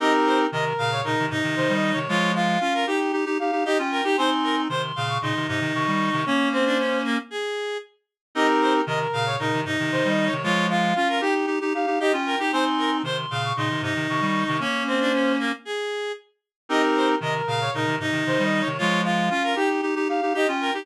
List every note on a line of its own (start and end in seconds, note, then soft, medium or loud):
0.00 0.47 C4 medium
0.00 0.47 D#4 medium
0.00 0.45 G4 medium
0.00 0.45 A#4 medium
0.00 0.12 D#5 loud
0.26 0.38 C5 medium
0.52 0.73 C3 medium
0.52 0.73 D#3 medium
0.52 0.90 A#4 medium
0.52 0.65 D#5 medium
0.78 1.02 A#2 medium
0.78 1.02 C#3 medium
0.78 1.01 F5 loud
0.92 1.04 C#5 medium
1.04 1.17 A#2 medium
1.04 1.17 C#3 medium
1.04 1.26 D#4 medium
1.04 1.26 A#4 medium
1.19 1.29 C3 medium
1.19 1.31 D#3 medium
1.30 1.42 G#2 medium
1.30 1.42 C3 medium
1.30 1.99 D#4 loud
1.43 1.55 C3 medium
1.43 1.55 D#3 medium
1.56 1.69 C3 medium
1.56 1.68 D#3 medium
1.56 1.72 C5 medium
1.69 1.93 D#3 medium
1.69 1.93 G3 medium
1.74 1.91 D#5 medium
1.92 2.08 C3 medium
1.92 2.08 D#3 medium
1.92 2.08 C#5 medium
2.08 2.58 F3 medium
2.08 2.58 G#3 medium
2.08 2.32 F4 loud
2.08 2.33 C#5 medium
2.35 2.59 F4 loud
2.35 2.83 F5 medium
2.61 2.85 C#4 medium
2.61 2.85 F4 medium
2.61 2.73 F4 loud
2.74 2.86 A#4 medium
2.87 3.12 D#4 medium
2.87 3.12 G4 medium
2.87 2.99 G4 medium
2.87 3.13 G5 medium
3.12 3.25 D#4 medium
3.12 3.25 G4 medium
3.25 3.38 D#4 medium
3.25 3.38 G4 medium
3.39 3.51 D#4 medium
3.39 3.51 G4 medium
3.39 3.63 F5 medium
3.52 3.64 D#4 medium
3.52 3.64 G4 medium
3.65 3.78 D#4 medium
3.65 3.78 G4 loud
3.65 3.78 G4 medium
3.65 3.78 D#5 medium
3.78 4.01 C#4 medium
3.78 4.01 F4 medium
3.78 3.91 G5 medium
3.91 4.04 A#4 medium
3.91 4.16 G5 medium
4.04 4.16 D#4 medium
4.04 4.16 G4 medium
4.04 4.17 G4 medium
4.17 4.68 C4 medium
4.17 4.68 D#4 medium
4.17 4.30 C5 loud
4.17 4.62 G#5 medium
4.17 4.62 C6 medium
4.43 4.56 A#4 medium
4.69 4.92 C3 medium
4.69 4.92 D#3 medium
4.69 4.82 C5 medium
4.69 5.06 C6 medium
4.96 5.18 A#2 medium
4.96 5.18 C#3 medium
4.96 5.18 F5 medium
5.09 5.21 C#6 medium
5.22 5.34 A#2 medium
5.22 5.34 C#3 medium
5.22 5.47 D#4 medium
5.22 5.45 C6 medium
5.35 5.47 C3 medium
5.35 5.48 D#3 medium
5.48 5.60 G#2 medium
5.48 5.60 C3 medium
5.48 6.23 D#4 loud
5.61 5.73 C3 medium
5.61 5.73 D#3 medium
5.74 5.87 C3 medium
5.74 5.87 D#3 medium
5.74 5.91 C#6 medium
5.87 6.10 D#3 medium
5.87 6.10 G3 medium
5.92 6.08 C#6 medium
6.09 6.25 C3 medium
6.09 6.25 D#3 medium
6.09 6.25 C#6 medium
6.26 7.19 A#3 medium
6.26 6.49 C#4 loud
6.26 7.19 C#4 medium
6.26 6.49 C#5 medium
6.52 6.65 C4 medium
6.52 6.98 C5 medium
6.65 6.78 D4 loud
6.78 7.02 C#4 medium
7.04 7.17 A#3 loud
7.30 7.77 G#4 medium
8.35 8.82 C4 medium
8.35 8.82 D#4 medium
8.35 8.80 G4 medium
8.35 8.80 A#4 medium
8.35 8.47 D#5 loud
8.61 8.73 C5 medium
8.86 9.07 C3 medium
8.86 9.07 D#3 medium
8.86 9.25 A#4 medium
8.86 8.99 D#5 medium
9.13 9.37 A#2 medium
9.13 9.37 C#3 medium
9.13 9.36 F5 loud
9.26 9.38 C#5 medium
9.39 9.52 A#2 medium
9.39 9.52 C#3 medium
9.39 9.60 D#4 medium
9.39 9.61 A#4 medium
9.53 9.65 C3 medium
9.53 9.65 D#3 medium
9.65 9.77 G#2 medium
9.65 9.77 C3 medium
9.65 10.33 D#4 loud
9.79 9.91 C3 medium
9.79 9.91 D#3 medium
9.92 10.04 C3 medium
9.92 10.04 D#3 medium
9.92 10.08 C5 medium
10.05 10.29 D#3 medium
10.05 10.29 G3 medium
10.05 10.25 D#5 medium
10.26 10.42 C#5 medium
10.32 10.44 C3 medium
10.32 10.44 D#3 medium
10.43 10.93 F3 medium
10.43 10.93 G#3 medium
10.43 10.66 F4 loud
10.43 10.68 C#5 medium
10.70 10.94 F4 loud
10.70 11.18 F5 medium
10.96 11.21 C#4 medium
10.96 11.08 F4 loud
10.96 11.21 F4 medium
11.09 11.21 A#4 medium
11.21 11.46 D#4 medium
11.21 11.46 G4 medium
11.21 11.34 G4 medium
11.21 11.47 G5 medium
11.46 11.59 D#4 medium
11.46 11.59 G4 medium
11.61 11.73 D#4 medium
11.61 11.73 G4 medium
11.74 11.86 D#4 medium
11.74 11.86 G4 medium
11.74 11.98 F5 medium
11.86 11.99 D#4 medium
11.86 11.99 G4 medium
12.00 12.12 D#4 medium
12.00 12.12 G4 medium
12.00 12.12 G4 loud
12.00 12.12 D#5 medium
12.13 12.36 C#4 medium
12.13 12.36 F4 medium
12.13 12.25 G5 medium
12.26 12.38 A#4 medium
12.26 12.50 G5 medium
12.39 12.52 D#4 medium
12.39 12.52 G4 medium
12.52 13.02 C4 medium
12.52 13.02 D#4 medium
12.52 12.65 C5 loud
12.52 12.97 G#5 medium
12.52 12.97 C6 medium
12.78 12.91 A#4 medium
13.03 13.26 C3 medium
13.03 13.26 D#3 medium
13.03 13.17 C5 medium
13.03 13.41 C6 medium
13.30 13.53 A#2 medium
13.30 13.53 C#3 medium
13.30 13.52 F5 medium
13.44 13.57 C#6 medium
13.57 13.69 A#2 medium
13.57 13.69 C#3 medium
13.57 13.82 D#4 medium
13.57 13.80 C6 medium
13.70 13.81 C3 medium
13.70 13.82 D#3 medium
13.82 13.94 G#2 medium
13.82 13.94 C3 medium
13.82 14.57 D#4 loud
13.95 14.07 C3 medium
13.95 14.07 D#3 medium
14.09 14.22 C3 medium
14.09 14.20 D#3 medium
14.09 14.25 C#6 medium
14.21 14.44 D#3 medium
14.21 14.44 G3 medium
14.26 14.42 C#6 medium
14.44 14.60 C3 medium
14.44 14.60 D#3 medium
14.44 14.60 C#6 medium
14.60 15.52 A#3 medium
14.60 15.52 C#4 medium
14.60 14.83 C#4 loud
14.60 14.83 C#5 medium
14.87 14.99 C4 medium
14.87 15.32 C5 medium
15.00 15.12 D4 loud
15.13 15.37 C#4 medium
15.39 15.52 A#3 loud
15.65 16.12 G#4 medium
16.69 17.16 C4 medium
16.69 17.16 D#4 medium
16.69 17.14 G4 medium
16.69 17.14 A#4 medium
16.69 16.82 D#5 loud
16.96 17.08 C5 medium
17.21 17.42 C3 medium
17.21 17.42 D#3 medium
17.21 17.60 A#4 medium
17.21 17.34 D#5 medium
17.47 17.70 A#2 medium
17.47 17.70 C#3 medium
17.47 17.70 F5 loud
17.61 17.73 C#5 medium
17.74 17.86 A#2 medium
17.74 17.86 C#3 medium
17.74 17.95 D#4 medium
17.74 17.96 A#4 medium
17.86 17.99 C3 medium
17.86 17.99 D#3 medium
17.99 18.12 G#2 medium
17.99 18.11 C3 medium
17.99 18.68 D#4 loud
18.12 18.24 C3 medium
18.12 18.24 D#3 medium
18.26 18.39 C3 medium
18.26 18.38 D#3 medium
18.26 18.43 C5 medium
18.38 18.62 D#3 medium
18.38 18.62 G3 medium
18.43 18.60 D#5 medium
18.60 18.77 C#5 medium
18.66 18.79 C3 medium
18.66 18.79 D#3 medium
18.78 19.29 F3 medium
18.78 19.29 G#3 medium
18.78 19.01 F4 loud
18.78 19.02 C#5 medium
19.04 19.29 F4 loud
19.04 19.53 F5 medium
19.30 19.55 C#4 medium
19.30 19.55 F4 medium
19.30 19.43 F4 loud
19.43 19.56 A#4 medium
19.56 19.81 D#4 medium
19.56 19.81 G4 medium
19.56 19.69 G4 medium
19.56 19.81 G5 medium
19.82 19.95 D#4 medium
19.82 19.95 G4 medium
19.96 20.08 D#4 medium
19.96 20.08 G4 medium
20.08 20.21 D#4 medium
20.08 20.21 G4 medium
20.08 20.33 F5 medium
20.22 20.33 D#4 medium
20.22 20.33 G4 medium
20.34 20.46 D#4 medium
20.34 20.46 G4 medium
20.34 20.47 G4 loud
20.34 20.48 D#5 medium
20.48 20.71 C#4 medium
20.48 20.71 F4 medium
20.48 20.61 G5 medium
20.61 20.73 A#4 medium
20.61 20.86 G5 medium
20.74 20.86 D#4 medium
20.74 20.86 G4 medium